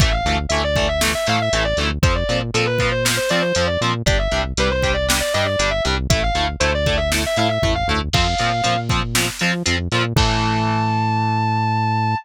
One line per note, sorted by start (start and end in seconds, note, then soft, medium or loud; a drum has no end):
0.00 0.22 A1 medium
0.00 0.10 E3 loud
0.00 0.10 A3 loud
0.00 0.14 E5 medium
0.00 kick loud
0.00 closed hi-hat loud
0.12 0.37 F5 medium
0.25 0.46 D2 medium
0.25 0.36 E3 medium
0.25 0.36 A3 medium
0.25 closed hi-hat medium
0.49 1.15 D2 medium
0.49 0.62 E3 medium
0.49 0.62 A3 medium
0.49 0.61 E5 medium
0.49 closed hi-hat loud
0.64 0.87 D5 medium
0.76 0.86 E3 medium
0.76 0.86 A3 medium
0.76 kick medium
0.76 closed hi-hat medium
0.89 1.01 E5 medium
1.01 1.12 E3 medium
1.01 1.12 A3 medium
1.01 snare loud
1.15 1.27 E5 medium
1.26 1.49 A2 medium
1.26 1.37 E3 medium
1.26 1.37 A3 medium
1.26 1.41 F5 medium
1.26 closed hi-hat medium
1.42 1.63 E5 medium
1.53 1.74 A1 medium
1.53 1.63 E3 medium
1.53 1.63 A3 medium
1.53 closed hi-hat loud
1.65 1.77 D5 medium
1.77 1.98 D2 medium
1.77 1.88 E3 medium
1.77 1.88 A3 medium
1.77 closed hi-hat medium
2.02 2.24 F2 medium
2.02 2.13 F3 medium
2.02 2.13 C4 loud
2.02 2.15 C5 loud
2.02 kick loud
2.02 closed hi-hat medium
2.15 2.37 D5 medium
2.29 2.51 A#2 medium
2.29 2.39 F3 medium
2.29 2.39 C4 medium
2.29 closed hi-hat medium
2.54 3.19 A#2 medium
2.54 2.64 F3 medium
2.54 2.64 C4 medium
2.54 2.66 A4 medium
2.54 closed hi-hat medium
2.66 2.88 B4 medium
2.78 2.90 F3 medium
2.78 2.90 C4 medium
2.78 kick medium
2.78 closed hi-hat medium
2.91 3.03 C5 medium
3.05 3.15 F3 medium
3.05 3.15 C4 medium
3.05 snare loud
3.17 3.29 C5 medium
3.29 3.41 F3 medium
3.29 3.53 F3 medium
3.29 3.41 C4 medium
3.29 3.42 D5 medium
3.29 closed hi-hat medium
3.42 3.65 C5 medium
3.55 3.78 F2 medium
3.55 3.66 F3 medium
3.55 3.66 C4 medium
3.55 closed hi-hat loud
3.67 3.79 D5 medium
3.81 4.03 A#2 medium
3.81 3.92 F3 medium
3.81 3.92 C4 medium
3.81 closed hi-hat medium
4.06 4.28 G1 medium
4.06 4.16 G3 loud
4.06 4.16 D4 medium
4.06 4.19 D5 loud
4.06 kick loud
4.06 closed hi-hat loud
4.18 4.41 E5 medium
4.31 4.53 C2 medium
4.31 4.42 G3 medium
4.31 4.42 D4 medium
4.31 closed hi-hat medium
4.57 5.22 C2 medium
4.57 4.68 G3 medium
4.57 4.68 D4 medium
4.57 4.72 B4 medium
4.57 closed hi-hat medium
4.70 4.92 C5 medium
4.82 4.93 G3 medium
4.82 4.93 D4 medium
4.82 kick medium
4.82 closed hi-hat medium
4.94 5.06 D5 medium
5.09 5.19 G3 medium
5.09 5.19 D4 medium
5.09 snare loud
5.20 5.33 D5 medium
5.34 5.56 G2 medium
5.34 5.44 G3 medium
5.34 5.44 D4 medium
5.34 5.46 D#5 medium
5.34 closed hi-hat medium
5.46 5.70 D5 medium
5.59 5.81 G1 medium
5.59 5.69 G3 medium
5.59 5.69 D4 medium
5.59 closed hi-hat loud
5.71 5.83 E5 medium
5.85 6.07 C2 medium
5.85 5.95 G3 medium
5.85 5.95 D4 medium
5.85 closed hi-hat medium
6.10 6.31 A1 medium
6.10 6.20 A3 loud
6.10 6.20 E4 medium
6.10 6.22 E5 medium
6.10 kick loud
6.10 closed hi-hat loud
6.23 6.46 F5 medium
6.34 6.56 D2 medium
6.34 6.45 A3 medium
6.34 6.45 E4 medium
6.34 closed hi-hat medium
6.60 7.26 D2 medium
6.60 6.71 A3 medium
6.60 6.71 E4 medium
6.60 6.72 C5 medium
6.60 closed hi-hat loud
6.74 6.97 D5 medium
6.86 6.97 A3 medium
6.86 6.97 E4 medium
6.86 kick medium
6.86 closed hi-hat medium
6.97 7.09 E5 medium
7.12 7.22 A3 medium
7.12 7.22 E4 medium
7.12 snare medium
7.26 7.38 E5 medium
7.36 7.59 A2 medium
7.36 7.47 A3 medium
7.36 7.47 E4 loud
7.36 7.49 F5 medium
7.36 closed hi-hat medium
7.49 7.72 E5 medium
7.62 7.84 A1 medium
7.62 7.73 A3 medium
7.62 7.73 E4 medium
7.62 kick medium
7.62 floor tom medium
7.75 7.87 F5 medium
7.88 8.09 D2 medium
7.88 7.99 A3 medium
7.88 7.99 E4 medium
8.13 8.35 F2 medium
8.13 8.25 F3 loud
8.13 8.25 C4 loud
8.13 8.78 F5 medium
8.13 kick medium
8.13 crash loud
8.38 8.62 A#2 medium
8.38 8.50 F3 loud
8.38 8.50 C4 medium
8.38 closed hi-hat medium
8.64 9.30 A#2 medium
8.64 8.74 F3 medium
8.64 8.74 C4 medium
8.64 closed hi-hat loud
8.89 9.00 F3 medium
8.89 9.00 C4 medium
8.89 kick medium
8.89 closed hi-hat medium
9.15 9.26 F3 medium
9.15 9.26 C4 medium
9.15 snare loud
9.39 9.51 F3 medium
9.39 9.63 F3 medium
9.39 9.51 C4 medium
9.39 closed hi-hat medium
9.66 9.88 F2 medium
9.66 9.76 F3 medium
9.66 9.76 C4 medium
9.66 closed hi-hat loud
9.92 10.13 A#2 medium
9.92 10.02 F3 medium
9.92 10.02 C4 medium
9.92 closed hi-hat medium
10.16 12.15 A2 loud
10.16 12.16 E3 loud
10.16 12.16 A3 medium
10.16 12.16 A5 loud
10.16 kick loud
10.16 crash loud